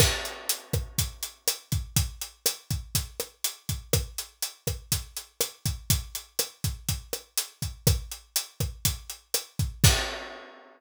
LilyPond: \new DrumStaff \drummode { \time 4/4 \tempo 4 = 122 <cymc bd ss>8 hh8 hh8 <hh bd ss>8 <hh bd>8 hh8 <hh ss>8 <hh bd>8 | <hh bd>8 hh8 <hh ss>8 <hh bd>8 <hh bd>8 <hh ss>8 hh8 <hh bd>8 | <hh bd ss>8 hh8 hh8 <hh bd ss>8 <hh bd>8 hh8 <hh ss>8 <hh bd>8 | <hh bd>8 hh8 <hh ss>8 <hh bd>8 <hh bd>8 <hh ss>8 hh8 <hh bd>8 |
<hh bd ss>8 hh8 hh8 <hh bd ss>8 <hh bd>8 hh8 <hh ss>8 <hh bd>8 | <cymc bd>4 r4 r4 r4 | }